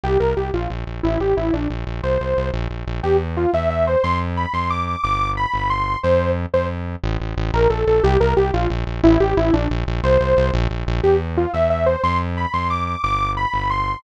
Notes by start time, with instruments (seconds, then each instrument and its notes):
0.04 synth bass 1 C2, lead 2 (sawtooth) G4
0.20 synth bass 1 C2, lead 2 (sawtooth) A#4
0.37 synth bass 1 C2, lead 2 (sawtooth) G4
0.53 synth bass 1 A#1, lead 2 (sawtooth) F4
0.70 synth bass 1 A#1
0.87 synth bass 1 A#1
1.03 synth bass 1 A1, lead 2 (sawtooth) E4
1.20 synth bass 1 A1, lead 2 (sawtooth) G4
1.37 synth bass 1 A1, lead 2 (sawtooth) E4
1.53 synth bass 1 A#1, lead 2 (sawtooth) D4
1.70 synth bass 1 A#1
1.87 synth bass 1 A#1
2.03 synth bass 1 C2, lead 2 (sawtooth) C5
2.20 synth bass 1 C2
2.37 synth bass 1 C2
2.54 synth bass 1 A#1
2.70 synth bass 1 A#1
2.87 synth bass 1 A#1
3.03 synth bass 1 E2, lead 2 (sawtooth) G4
3.37 lead 2 (sawtooth) F4
3.53 synth bass 1 E2, lead 2 (sawtooth) E5
3.70 lead 2 (sawtooth) E5
3.87 lead 2 (sawtooth) C5
4.03 synth bass 1 F2, lead 2 (sawtooth) C6
4.37 lead 2 (sawtooth) B5
4.53 synth bass 1 F2, lead 2 (sawtooth) C6
4.70 lead 2 (sawtooth) D6
4.87 lead 2 (sawtooth) D6
5.03 synth bass 1 G1, lead 2 (sawtooth) D6
5.37 lead 2 (sawtooth) B5
5.53 synth bass 1 G1
5.70 lead 2 (sawtooth) C6
6.03 synth bass 1 F2, lead 2 (sawtooth) C5
6.53 synth bass 1 F2, lead 2 (sawtooth) C5
7.03 synth bass 1 A1
7.20 synth bass 1 A1
7.37 synth bass 1 A1
7.53 synth bass 1 A#1, lead 2 (sawtooth) A#4
7.70 synth bass 1 A#1, lead 2 (sawtooth) A4
7.87 synth bass 1 A#1, lead 2 (sawtooth) A4
8.03 synth bass 1 C2, lead 2 (sawtooth) G4
8.20 synth bass 1 C2, lead 2 (sawtooth) A#4
8.37 synth bass 1 C2, lead 2 (sawtooth) G4
8.53 synth bass 1 A#1, lead 2 (sawtooth) F4
8.70 synth bass 1 A#1
8.87 synth bass 1 A#1
9.03 synth bass 1 A1, lead 2 (sawtooth) E4
9.20 synth bass 1 A1, lead 2 (sawtooth) G4
9.37 synth bass 1 A1, lead 2 (sawtooth) E4
9.53 synth bass 1 A#1, lead 2 (sawtooth) D4
9.70 synth bass 1 A#1
9.87 synth bass 1 A#1
10.03 synth bass 1 C2, lead 2 (sawtooth) C5
10.20 synth bass 1 C2
10.37 synth bass 1 C2
10.53 synth bass 1 A#1
10.70 synth bass 1 A#1
10.87 synth bass 1 A#1
11.03 synth bass 1 E2, lead 2 (sawtooth) G4
11.37 lead 2 (sawtooth) F4
11.53 synth bass 1 E2, lead 2 (sawtooth) E5
11.70 lead 2 (sawtooth) E5
11.86 lead 2 (sawtooth) C5
12.03 synth bass 1 F2, lead 2 (sawtooth) C6
12.37 lead 2 (sawtooth) B5
12.53 synth bass 1 F2, lead 2 (sawtooth) C6
12.70 lead 2 (sawtooth) D6
12.87 lead 2 (sawtooth) D6
13.03 synth bass 1 G1, lead 2 (sawtooth) D6
13.37 lead 2 (sawtooth) B5
13.53 synth bass 1 G1
13.70 lead 2 (sawtooth) C6